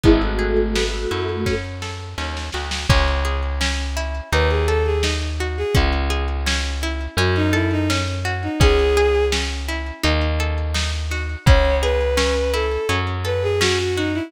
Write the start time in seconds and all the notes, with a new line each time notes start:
0.03 G#1 G#3 B3 E4, kick, closed hi-hat
0.22 A3 F#4
0.39 G#4
0.75 B3, snare
1.11 F#2 E4
1.46 C#4, kick, snare
1.82 A4, snare
2.18 D#2 C#4, snare
2.37 snare
2.52 D2 F#4, snare
2.71 snare
2.89 C#2 C#4, kick, crash
3.25 G#4, closed hi-hat
3.61 C#4, snare
3.97 E4, closed hi-hat
4.32 D#2 D#4 B4, closed hi-hat
4.50 G#4
4.68 A4, closed hi-hat
4.86 G#4
5.03 D#4, snare
5.40 F#4, closed hi-hat
5.58 G#4
5.75 C#2 C#4, kick, closed hi-hat
6.10 G#4, closed hi-hat
6.46 C#4, snare
6.81 E4, closed hi-hat
7.17 F#2 C#4 F#4, closed hi-hat
7.36 D#4
7.53 E4 A4, closed hi-hat
7.71 D#4
7.90 C#4, snare
8.25 F#4, closed hi-hat
8.43 D#4
8.60 C#2 C#4 G#4, kick, closed hi-hat
8.97 G#4, closed hi-hat
9.32 C#4, snare
9.68 E4, closed hi-hat
10.03 D#2 D#4, closed hi-hat
10.39 A4, closed hi-hat
10.74 D#4, snare
11.11 F#4, open hi-hat
11.46 C#2 C#4 C#5, kick, closed hi-hat
11.82 G#4 B4, closed hi-hat
12.17 C#4, snare
12.53 E4 A4, closed hi-hat
12.89 F#2 C#4, closed hi-hat
13.24 A4 B4, closed hi-hat
13.43 G#4
13.61 C#4 F#4, snare
13.79 F#4
13.96 D#4 F#4, closed hi-hat
14.14 E4